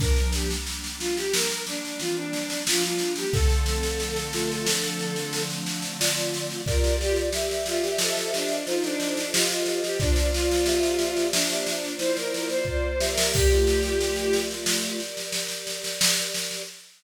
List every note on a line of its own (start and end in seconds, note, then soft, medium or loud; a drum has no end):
0.00 0.54 F3 loud
0.00 3.30 G3 medium
0.00 3.30 A#3 medium
0.00 0.54 D4 loud
0.00 3.30 D4 loud
0.00 0.30 A#4 medium
0.00 kick medium
0.00 snare medium
0.16 snare medium
0.33 0.49 G4 medium
0.33 snare medium
0.51 snare medium
0.67 snare medium
0.84 snare medium
0.99 1.15 F4 medium
0.99 snare medium
1.17 1.33 G4 medium
1.17 snare medium
1.33 1.63 A#4 medium
1.33 snare loud
1.51 snare medium
1.67 1.98 D4 medium
1.67 snare medium
1.85 snare medium
2.00 2.57 E3 medium
2.00 2.57 C4 medium
2.00 2.16 F4 medium
2.00 snare medium
2.16 2.61 D4 medium
2.33 snare medium
2.50 snare medium
2.67 3.24 F3 medium
2.67 3.24 D4 loud
2.67 2.83 F4 medium
2.67 snare loud
2.83 3.12 F4 medium
2.83 snare medium
2.98 snare medium
3.16 3.32 G4 medium
3.16 snare medium
3.33 6.63 D3 loud
3.33 6.63 F3 medium
3.33 6.63 A3 medium
3.33 6.63 C4 loud
3.33 4.19 C4 loud
3.33 5.42 A4 medium
3.33 4.19 A4 loud
3.33 kick medium
3.33 snare medium
3.49 snare medium
3.66 snare medium
3.83 snare medium
4.00 snare medium
4.16 snare medium
4.33 4.66 A3 medium
4.33 4.66 F4 loud
4.33 snare medium
4.52 snare medium
4.67 5.92 F3 loud
4.67 5.92 D4 loud
4.67 snare medium
4.83 snare medium
4.99 snare medium
5.16 snare medium
5.33 snare medium
5.50 snare medium
5.66 snare medium
5.82 snare medium
6.00 6.61 F4 loud
6.00 6.61 D5 loud
6.00 snare loud
6.17 snare medium
6.34 snare medium
6.50 snare medium
6.66 7.29 F4 loud
6.66 8.00 G4 loud
6.66 6.96 A#4 medium
6.66 8.00 A#4 medium
6.66 7.29 D5 loud
6.66 8.00 D5 loud
6.66 kick medium
6.66 snare medium
6.84 snare medium
7.00 7.16 G4 medium
7.00 snare medium
7.16 snare medium
7.33 8.57 G4 loud
7.33 8.57 E5 loud
7.33 snare medium
7.51 snare medium
7.66 7.83 F4 medium
7.66 snare medium
7.83 7.99 G4 medium
7.83 snare medium
7.98 9.98 F4 loud
7.98 8.30 A4 medium
7.98 9.98 A4 loud
7.98 9.98 C5 loud
7.98 9.98 D#5 medium
7.98 snare medium
8.17 snare medium
8.34 8.64 D4 medium
8.34 snare medium
8.49 snare medium
8.67 9.22 D#4 loud
8.67 8.83 F4 medium
8.67 9.22 C5 loud
8.67 snare medium
8.83 9.29 D4 medium
8.83 snare medium
9.00 snare medium
9.17 snare medium
9.33 9.49 F4 medium
9.33 9.63 G4 loud
9.33 9.63 D#5 loud
9.33 snare loud
9.50 9.80 F4 medium
9.50 snare medium
9.66 9.98 G4 medium
9.66 9.98 D#5 loud
9.66 snare medium
9.83 9.99 G4 medium
9.83 snare medium
10.00 13.30 A#3 medium
10.00 10.28 D4 medium
10.00 10.65 F4 loud
10.00 13.30 F4 loud
10.00 13.30 C5 medium
10.00 10.65 D5 loud
10.00 13.30 D5 loud
10.00 kick medium
10.00 snare medium
10.16 snare medium
10.33 11.26 F4 medium
10.33 snare medium
10.51 snare medium
10.66 11.74 G4 medium
10.66 11.74 E5 medium
10.66 snare medium
10.83 snare medium
10.99 snare medium
11.17 snare medium
11.33 11.94 D4 medium
11.33 snare loud
11.50 snare medium
11.67 snare medium
11.84 snare medium
11.99 12.64 E4 loud
11.99 12.16 C5 medium
11.99 12.64 C5 loud
11.99 snare medium
12.17 12.32 A#4 medium
12.17 snare medium
12.33 12.49 A#4 medium
12.33 snare medium
12.49 12.66 C5 medium
12.49 snare medium
12.65 12.95 F4 medium
12.65 12.88 C5 medium
12.65 12.95 D5 loud
12.65 kick medium
12.89 13.10 C5 medium
13.00 13.32 G4 loud
13.00 13.32 E5 loud
13.00 snare medium
13.11 13.32 A#4 medium
13.18 snare medium
13.33 13.49 A#3 medium
13.33 16.63 G4 medium
13.33 13.49 G4 loud
13.33 14.40 G4 medium
13.33 16.63 A#4 loud
13.33 16.63 D5 loud
13.33 kick medium
13.33 snare medium
13.33 crash medium
13.50 15.01 A3 medium
13.50 15.01 F4 medium
13.50 snare medium
13.67 snare medium
13.83 snare medium
14.01 snare medium
14.16 snare medium
14.33 snare medium
14.51 snare medium
14.66 snare medium
14.82 snare medium
15.00 snare medium
15.17 snare medium
15.32 snare medium
15.48 snare medium
15.67 snare medium
15.84 snare medium
16.01 snare loud
16.17 snare medium
16.34 snare medium
16.51 snare medium